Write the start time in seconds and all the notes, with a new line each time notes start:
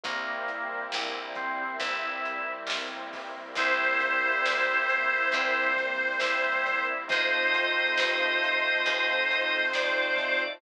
0.03 C2 G3 A#3 C4 E4, kick, closed hi-hat
0.48 closed hi-hat
0.92 A#1, snare
1.35 C4, kick, closed hi-hat
1.80 G1 G3 A#3 C4 E4, kick, closed hi-hat
2.25 closed hi-hat
2.67 B1, snare
3.13 kick, open hi-hat
3.55 C2 G3 A#3 C4 E4 C5, kick, closed hi-hat
4.00 kick, closed hi-hat
4.45 D2, snare
4.89 closed hi-hat
5.32 E2 G3 A#3 C4 E4, kick, closed hi-hat
5.77 kick, closed hi-hat
6.19 E2 E4, snare
6.66 closed hi-hat
7.08 A3 C4 D#4 F4 C5 D#5, kick, closed hi-hat
7.12 F2
7.53 kick, closed hi-hat
7.97 G2, snare
8.44 closed hi-hat
8.86 D#2 A3 C4 D#4 F4, kick, closed hi-hat
9.31 closed hi-hat
9.73 F2 D5, snare
10.17 kick, closed hi-hat